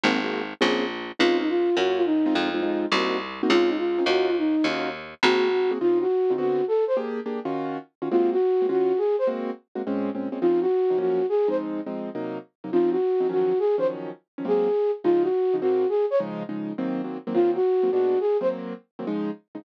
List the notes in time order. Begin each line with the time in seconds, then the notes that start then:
0.03 G#1 A#3 C4 F#4 G#4
0.24 A#3 C4 F#4 G#4
0.61 A#1 A#3 C4 C#4 G#4
1.19 C#2 C4 C#4 D#4 F4
1.40 D#4
1.49 F4
1.77 F#2 A#3 C#4 F4 F#4
1.96 F4
2.06 D#4
2.26 G#3 C4 D#4 F4
2.35 F2
2.54 G#3 C4 D#4 F4
2.63 G#3 C4 D#4 F4
2.92 C2 A#3 C4 D#4 F#4
3.43 A#3 C4 D#4 F#4
3.50 C#2 C4 C#4 D#4 F4
3.68 D#4
3.78 F4
3.98 C4 C#4 D#4 F4
4.06 D#2 C#4 D#4 F4 F#4
4.28 F4
4.38 D#4
4.64 D#2 C#4 D#4 F4 F#4
5.23 G#1 A#3 C4 F#4 G#4
5.71 A#3 C4 F#4 G#4
5.81 C#3 C4 D#4 F4
6.01 F#4
6.30 C#3 C4 D#4 F4
6.38 D3 B3 C4 F#4
6.68 A4
6.87 C5
6.97 A#3 D4 G4 G#4
7.26 A#3 D4 G4 G#4
7.45 D#3 C#4 F4 F#4
8.02 D#3 C#4 F4 F#4
8.11 G#3 A#3 C4 F4 F#4
8.32 F#4
8.62 G#3 A#3 C4 F#4
8.69 D#3 C#4 F4 F#4
8.98 G#4
9.19 C5
9.27 G#3 A#3 C4 F#4
9.75 G#3 A#3 C4 F#4
9.87 A#2 G#3 C4 C#4
10.15 A#2 G#3 C4 C#4
10.32 A#2 G#3 C4 C#4
10.41 C#3 F3 C4 D#4 F4
10.61 F#4
10.90 C#3 F3 C4 D#4
10.98 F#2 F3 A#3 C#4 F#4
11.29 G#4
11.48 F3 G#3 C4 D#4 C5
11.86 F3 G#3 C4 D#4
12.15 C3 F#3 A#3 D#4
12.64 C3 F#3 A#3 D#4
12.72 C#3 F3 C4 D#4 F4
12.91 F#4
13.20 C#3 F3 C4 D#4
13.29 D#3 F3 F#3 C#4 F#4
13.59 G#4
13.78 D#3 F3 F#3 C#4 C5
14.38 D#3 F3 F#3 C#4
14.45 G#2 F#3 A#3 C4 G#4
15.04 C#3 F3 G#3 D#4 F4
15.22 F#4
15.54 C#3 F3 G#3 D#4
15.61 G#2 F#3 A#3 C4 F#4
15.89 G#4
16.10 C#5
16.20 C#3 F3 G#3 D#4
16.49 C#3 F3 G#3 D#4
16.78 D#3 F#3 A#3 C4
17.04 D#3 F#3 A#3 C4
17.27 D#3 F#3 A#3 C4
17.34 D#3 F#3 A#3 C4 F4
17.55 F#4
17.83 D#3 F#3 A#3 C4
17.92 A#2 G#3 B3 D4 F#4
18.20 G#4
18.41 D#3 F#3 A#3 C4 C5
18.99 D#3 F#3 A#3 C4
19.07 C#3 F3 G#3 D#4
19.55 C#3 F3 G#3 D#4